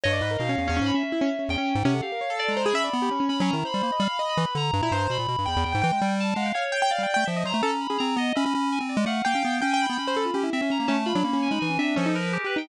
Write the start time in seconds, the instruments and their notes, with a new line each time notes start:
0.03 lead 1 (square) G2, acoustic grand piano C#5, electric piano 2 D#5
0.13 acoustic grand piano D5
0.21 lead 1 (square) G#2, acoustic grand piano B4
0.31 acoustic grand piano A#4
0.38 lead 1 (square) B2, acoustic grand piano D#4, electric piano 2 F5
0.49 acoustic grand piano C#4
0.58 lead 1 (square) E2, acoustic grand piano C#4
0.68 lead 1 (square) E2, acoustic grand piano C#4
0.77 acoustic grand piano C#4
0.81 lead 1 (square) G#2
0.86 electric piano 2 B5
0.94 acoustic grand piano C#4, electric piano 2 E5
1.03 acoustic grand piano C#4
1.12 acoustic grand piano E4
1.21 acoustic grand piano C#4
1.39 acoustic grand piano C#4
1.49 lead 1 (square) E2, electric piano 2 G5
1.58 acoustic grand piano C#4
1.75 lead 1 (square) G#2
1.84 lead 1 (square) C3, acoustic grand piano C#4, electric piano 2 F#5
1.94 acoustic grand piano A4
2.02 acoustic grand piano G4, electric piano 2 F5
2.12 acoustic grand piano A#4
2.21 acoustic grand piano C#5
2.30 acoustic grand piano A4
2.39 electric piano 2 D5
2.48 lead 1 (square) G#3, electric piano 2 A#5
2.57 acoustic grand piano C5
2.63 acoustic grand piano G#4, electric piano 2 B5
2.73 lead 1 (square) C#4, acoustic grand piano E5, electric piano 2 B5
2.84 acoustic grand piano D5
2.93 lead 1 (square) B3
3.02 acoustic grand piano G4
3.11 acoustic grand piano C#4
3.20 acoustic grand piano C#4
3.29 acoustic grand piano C#4, lead 1 (square) C#4, electric piano 2 B5
3.38 lead 1 (square) F#3, acoustic grand piano C#4, electric piano 2 B5
3.47 electric piano 2 A#5
3.53 lead 1 (square) D#3, acoustic grand piano E4
3.65 acoustic grand piano C5, electric piano 2 B5
3.74 lead 1 (square) G3
3.83 lead 1 (square) A#3
3.92 acoustic grand piano D#5
3.99 lead 1 (square) G3, acoustic grand piano F5, electric piano 2 B5
4.19 acoustic grand piano D#5
4.29 electric piano 2 B5
4.37 lead 1 (square) E3
4.46 acoustic grand piano B4
4.55 lead 1 (square) D3, electric piano 2 A#5
4.73 lead 1 (square) G2
4.82 lead 1 (square) A#2, acoustic grand piano E4
4.91 lead 1 (square) G2, acoustic grand piano C5
5.10 lead 1 (square) B2, electric piano 2 B5
5.19 lead 1 (square) A#2
5.28 lead 1 (square) B2
5.38 lead 1 (square) G2
5.46 lead 1 (square) E2, acoustic grand piano G5, electric piano 2 B5
5.56 lead 1 (square) E2
5.64 lead 1 (square) E2, electric piano 2 G5
5.72 lead 1 (square) G#2, acoustic grand piano G5
5.82 lead 1 (square) E3, acoustic grand piano G5
5.92 lead 1 (square) G#3
6.02 lead 1 (square) G3
6.09 acoustic grand piano G5
6.20 electric piano 2 A5
6.35 lead 1 (square) G#3, electric piano 2 F5, acoustic grand piano F#5
6.46 acoustic grand piano G5
6.54 electric piano 2 C#5, acoustic grand piano F5
6.72 acoustic grand piano G5
6.82 acoustic grand piano G5
6.90 electric piano 2 D5, acoustic grand piano F5
6.98 lead 1 (square) G3
7.03 acoustic grand piano G5
7.14 lead 1 (square) A3, acoustic grand piano G5
7.25 lead 1 (square) F3, electric piano 2 E5, acoustic grand piano G5
7.36 acoustic grand piano D#5
7.45 lead 1 (square) F#3, acoustic grand piano C5, electric piano 2 A#5
7.54 lead 1 (square) A3
7.63 lead 1 (square) C#4, acoustic grand piano A4
7.80 electric piano 2 B5
7.90 lead 1 (square) C#4, acoustic grand piano G#4
7.98 lead 1 (square) C4, electric piano 2 A#5
8.16 lead 1 (square) B3, electric piano 2 D#5
8.36 lead 1 (square) C#4, acoustic grand piano E5, electric piano 2 B5
8.46 lead 1 (square) C#4
8.55 lead 1 (square) C#4
8.72 electric piano 2 G#5
8.80 lead 1 (square) C4
8.89 acoustic grand piano D5
8.97 lead 1 (square) G#3
9.06 lead 1 (square) A3, acoustic grand piano F5, electric piano 2 F#5
9.24 lead 1 (square) A#3, electric piano 2 F5, acoustic grand piano G5
9.35 lead 1 (square) C#4
9.45 lead 1 (square) B3
9.62 lead 1 (square) C#4, acoustic grand piano G5
9.71 acoustic grand piano G5, electric piano 2 G#5
9.80 electric piano 2 B5
9.86 lead 1 (square) B3, acoustic grand piano G5
9.97 lead 1 (square) C#4, electric piano 2 B5
10.07 acoustic grand piano C5
10.16 acoustic grand piano A4
10.25 acoustic grand piano F4
10.34 lead 1 (square) C#4, acoustic grand piano G4
10.43 acoustic grand piano E4
10.53 lead 1 (square) C4, electric piano 2 E5
10.61 acoustic grand piano C#4, lead 1 (square) C#4
10.70 acoustic grand piano C#4, electric piano 2 A#5
10.80 lead 1 (square) A#3
10.87 lead 1 (square) A3, acoustic grand piano C#4, electric piano 2 A5
11.05 acoustic grand piano F4, electric piano 2 B5
11.15 lead 1 (square) F#3, acoustic grand piano D4
11.24 lead 1 (square) A#3, acoustic grand piano C#4
11.33 acoustic grand piano C#4
11.42 electric piano 2 G#5
11.51 lead 1 (square) G#3, acoustic grand piano D#4, electric piano 2 B5
11.60 lead 1 (square) E3, electric piano 2 G#5
11.70 acoustic grand piano C#4
11.78 lead 1 (square) C4, acoustic grand piano D4, electric piano 2 E5
11.96 lead 1 (square) F3, acoustic grand piano C#4, electric piano 2 A4
12.06 acoustic grand piano D#4
12.15 electric piano 2 A#4, acoustic grand piano B4
12.33 electric piano 2 G4, acoustic grand piano G#4
12.44 acoustic grand piano G4, electric piano 2 B4
12.56 acoustic grand piano D#4, electric piano 2 G5